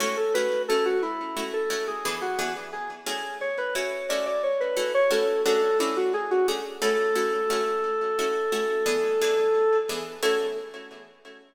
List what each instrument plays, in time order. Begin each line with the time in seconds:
0.00 pizzicato strings A3 C#4 E4 F#4, lead 1 (square) C#5
0.17 lead 1 (square) A4
0.34 pizzicato strings A3 C#4 E4 F#4, lead 1 (square) B4
0.68 pizzicato strings A3 C#4 E4 F#4, lead 1 (square) A4
0.85 lead 1 (square) F#4
1.02 lead 1 (square) E4
1.36 pizzicato strings A3 C#4 E4 F#4
1.53 lead 1 (square) A4
1.70 pizzicato strings A3 C#4 E4 F#4
1.87 lead 1 (square) G#4
2.05 pizzicato strings E3 B3 D4 G#4
2.22 lead 1 (square) F#4
2.38 pizzicato strings E3 B3 D4 G#4
2.73 lead 1 (square) G#4
3.06 pizzicato strings A3 C#4 E4 F#4, lead 1 (square) G#4
3.41 lead 1 (square) C#5
3.58 lead 1 (square) B4
3.75 pizzicato strings A3 C#4 E4 F#4, lead 1 (square) C#5
4.09 pizzicato strings A3 C#4 E4 F#4, lead 1 (square) D5
4.26 lead 1 (square) D5
4.43 lead 1 (square) C#5
4.60 lead 1 (square) B4
4.76 pizzicato strings A3 C#4 E4 F#4
4.94 lead 1 (square) C#5
5.10 pizzicato strings A3 C#4 E4 F#4, lead 1 (square) A4
5.45 pizzicato strings A3 C#4 D4 F#4, lead 1 (square) A4
5.80 pizzicato strings A3 C#4 D4 F#4, lead 1 (square) E4
5.97 lead 1 (square) F#4
6.14 lead 1 (square) G#4
6.31 lead 1 (square) F#4
6.48 pizzicato strings A3 C#4 D4 F#4, lead 1 (square) G#4
6.82 pizzicato strings A3 C#4 E4 F#4, lead 1 (square) A4
7.15 pizzicato strings A3 C#4 E4 F#4
7.50 pizzicato strings A3 C#4 E4 F#4
8.19 pizzicato strings A3 C#4 E4 F#4
8.52 pizzicato strings A3 C#4 E4 F#4
8.86 pizzicato strings E3 B3 D4 G#4
9.21 pizzicato strings E3 B3 D4 G#4
9.89 pizzicato strings E3 B3 D4 G#4
10.22 pizzicato strings A3 C#4 E4 F#4, lead 1 (square) A4